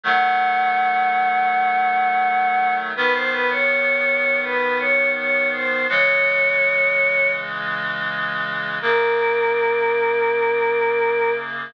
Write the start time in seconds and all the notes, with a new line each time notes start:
0.04 D#3 F#3 A3 F#5
2.96 G#2 D#3 B3 B4
3.14 C5
3.32 B4
3.50 C#5
4.43 B4
4.79 C#5
5.17 C#5
5.52 C5
5.89 C#3 E3 G#3 C#5
8.82 F#2 C#3 A#3 A#4